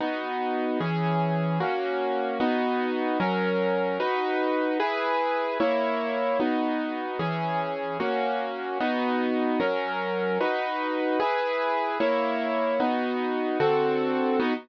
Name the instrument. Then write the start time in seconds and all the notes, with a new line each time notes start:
acoustic grand piano
0.01 B3 D#4 F#4
0.80 E3 C#4 G#4
1.60 A#3 C#4 F#4
2.40 B3 D#4 F#4
3.20 F#3 C#4 A#4
4.00 D#4 F#4 B4
4.80 E4 G#4 B4
5.60 A#3 E4 C#5
6.40 B3 D#4 F#4
7.19 E3 C#4 G#4
8.00 A#3 C#4 F#4
8.80 B3 D#4 F#4
9.60 F#3 C#4 A#4
10.41 D#4 F#4 B4
11.20 E4 G#4 B4
12.00 A#3 E4 C#5
12.80 B3 D#4 F#4
13.60 D3 C4 F#4 A4
14.40 B3 D#4 F#4